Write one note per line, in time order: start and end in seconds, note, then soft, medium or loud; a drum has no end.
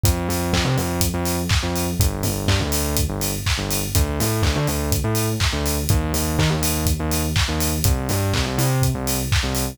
0.04 0.27 F2 loud
0.04 kick loud
0.04 closed hi-hat loud
0.29 0.51 F2 loud
0.29 open hi-hat medium
0.53 0.64 F2 loud
0.53 kick medium
0.53 clap loud
0.65 0.76 C3 loud
0.77 0.99 F2 loud
0.77 open hi-hat medium
1.01 kick medium
1.01 closed hi-hat loud
1.14 1.36 F2 loud
1.26 open hi-hat medium
1.49 kick loud
1.49 clap loud
1.63 1.85 F2 medium
1.76 open hi-hat medium
2.00 2.22 G1 loud
2.00 kick loud
2.00 closed hi-hat loud
2.23 2.46 G1 medium
2.23 open hi-hat medium
2.48 2.59 G2 medium
2.48 kick medium
2.48 clap loud
2.60 2.71 D2 medium
2.72 2.95 D2 loud
2.72 open hi-hat loud
2.97 kick medium
2.97 closed hi-hat loud
3.09 3.31 G1 medium
3.21 open hi-hat medium
3.46 kick medium
3.46 clap loud
3.58 3.80 G1 loud
3.71 open hi-hat loud
3.95 4.17 D2 loud
3.95 kick loud
3.95 closed hi-hat loud
4.20 4.42 A2 medium
4.20 open hi-hat medium
4.42 4.54 D2 loud
4.42 kick medium
4.42 clap loud
4.55 4.66 D3 loud
4.67 4.90 D2 loud
4.67 open hi-hat medium
4.92 kick medium
4.92 closed hi-hat loud
5.04 5.26 A2 medium
5.15 open hi-hat medium
5.40 kick loud
5.40 clap loud
5.53 5.75 D2 loud
5.66 open hi-hat medium
5.89 6.12 D#2 loud
5.89 kick loud
5.89 closed hi-hat loud
6.13 6.35 D#2 loud
6.13 open hi-hat medium
6.39 6.49 D#3 loud
6.39 kick medium
6.39 clap loud
6.50 6.61 D#2 medium
6.62 6.84 D#2 medium
6.62 open hi-hat loud
6.86 kick medium
6.86 closed hi-hat loud
7.00 7.22 D#2 loud
7.11 open hi-hat medium
7.36 kick loud
7.36 clap loud
7.48 7.70 D#2 medium
7.60 open hi-hat loud
7.84 8.07 C2 loud
7.84 kick loud
7.84 closed hi-hat loud
8.09 8.31 G2 loud
8.09 open hi-hat medium
8.34 8.45 C2 loud
8.34 kick medium
8.34 clap loud
8.46 8.57 C2 loud
8.58 8.80 C3 medium
8.58 open hi-hat medium
8.82 kick medium
8.82 closed hi-hat loud
8.95 9.17 C2 medium
9.07 open hi-hat loud
9.32 kick loud
9.32 clap loud
9.43 9.65 C2 medium
9.55 open hi-hat medium